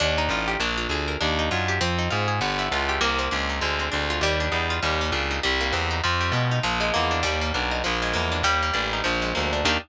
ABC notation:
X:1
M:4/4
L:1/8
Q:"Swing" 1/4=199
K:Eb
V:1 name="Acoustic Guitar (steel)"
D E F G D F A B | D E F G C E F A | =B, =E F G _B, C D _E | A, C D F G, D E F |
G, B, D E G, B, C E | F, G, A, E F, A, B, D | G, B, D E F, A, B, D | G, B, D E F, A, B, D |
[B,DEG]2 z6 |]
V:2 name="Electric Bass (finger)" clef=bass
E,,2 =A,,,2 B,,,2 D,,2 | E,,2 _G,,2 F,,2 A,,2 | G,,,2 _D,,2 C,,2 D,,2 | D,,2 D,,2 E,,2 =E,,2 |
E,,2 _D,,2 C,,2 =E,,2 | F,,2 =B,,2 _B,,,2 =E,,2 | E,,2 =B,,,2 _B,,,2 =E,,2 | E,,2 =A,,,2 B,,,2 D,,2 |
E,,2 z6 |]